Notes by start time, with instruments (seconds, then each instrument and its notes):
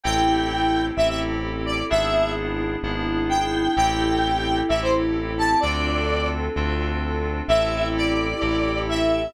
0.03 synth bass 1 A1, electric piano 2 C4 E4 G4 A4, string ensemble 1 C4 E4 G4 A4, lead 1 (square) G5
0.97 synth bass 1 A1, electric piano 2 C4 E4 G4 A4, lead 1 (square) E5
1.09 lead 1 (square) E5
1.66 lead 1 (square) D5
1.90 synth bass 1 G#1, electric piano 2 B3 D4 E4 G#4, string ensemble 1 B3 D4 E4 G#4, lead 1 (square) E5
2.83 synth bass 1 G#1, electric piano 2 B3 D4 E4 G#4
3.29 lead 1 (square) G5
3.76 synth bass 1 A1, electric piano 2 C4 E4 G4 A4, string ensemble 1 C4 E4 G4 A4, lead 1 (square) G5
4.69 synth bass 1 A1, electric piano 2 C4 E4 G4 A4, lead 1 (square) E5
4.82 lead 1 (square) C5
5.38 lead 1 (square) A5
5.60 synth bass 1 D2, electric piano 2 C4 D4 F4 A4, string ensemble 1 C4 D4 F4 A4, lead 1 (square) D5
6.56 synth bass 1 D2, electric piano 2 C4 D4 F4 A4
7.48 synth bass 1 A1, electric piano 2 C4 E4 G4 A4, string ensemble 1 C4 E4 G4 A4, lead 1 (square) E5
7.97 lead 1 (square) D5
8.41 synth bass 1 A1, electric piano 2 C4 E4 G4 A4
8.89 lead 1 (square) E5